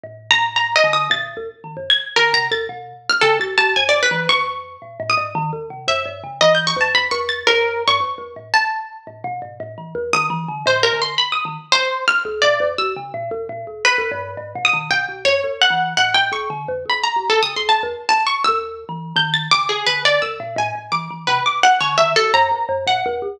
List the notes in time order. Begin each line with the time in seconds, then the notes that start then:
0.04 A2
0.31 A#5
0.56 A#5
0.76 D#5
0.84 D3
0.93 D#6
1.10 A#2 A6
1.37 D#2
1.64 D#3
1.77 F#2
1.90 G#6
2.16 D3 A#4
2.33 C3 A#5
2.51 D#2 A6
2.69 B2
3.10 F6
3.21 C#3 A4
3.39 C2 A6
3.58 C2 A5
3.76 F#2 G#5
3.89 D5
3.93 F#2
4.03 B4
4.11 E3
4.29 F2 C#6
4.82 A#2
5.00 A2
5.10 D#6
5.17 G#2
5.35 D#3
5.53 D#2
5.70 C3
5.88 F#2 E5
6.06 G2
6.24 C#3
6.41 E3 D#5
6.55 G6
6.67 C#6
6.76 F2
6.81 A5
6.95 B5
7.11 E2 C#6
7.29 A6
7.47 F#2 A#4
7.88 G2 C#6
8.00 F2
8.18 E2
8.36 A2
8.54 A5
9.07 A2
9.24 B2
9.42 G#2
9.60 A2
9.78 E3
9.95 E2
10.13 D#3 D#6
10.30 E3
10.48 D3
10.66 A2 C5
10.83 A#4
10.93 D3
11.02 C6
11.18 B5
11.32 D#6
11.45 D#3
11.72 C5
12.08 F6
12.25 D2
12.42 A#2 D5
12.60 F2
12.78 C2 E6
12.96 C#3
13.14 A#2
13.31 D#2
13.49 A#2
13.67 D2
13.85 B4
13.98 D#2
14.12 G2
14.37 G#2
14.55 B2
14.65 D#6
14.73 D#3
14.91 B2 G5
15.09 C2
15.25 F#2 C#5
15.44 D#2
15.62 F#5
15.70 E3
15.97 A2 F#5
16.14 A2 G5
16.32 D2 C#6
16.50 D3
16.68 F2
16.86 D2 B5
17.04 A#5
17.16 C2
17.30 D2 A4
17.43 C#3 D#6
17.56 D2 C6
17.69 D2 A5
17.83 E2
18.09 A5
18.27 C#6
18.44 D#2 E6
18.89 E3
19.16 D#3 G6
19.34 A6
19.51 C#3 D6
19.69 G#4
19.87 D3 B4
20.05 D5
20.22 D#2 E6
20.40 A#2
20.56 A2 G#5
20.75 A2
20.92 E3 D6
21.11 E3
21.27 C3 B4
21.46 D6
21.63 F#5
21.81 D3 C#5
21.98 D#3 E5
22.16 C2 A4
22.34 F#2 A#5
22.51 E2
22.69 F#2
22.87 A#2 F#5
23.06 E2
23.22 C#2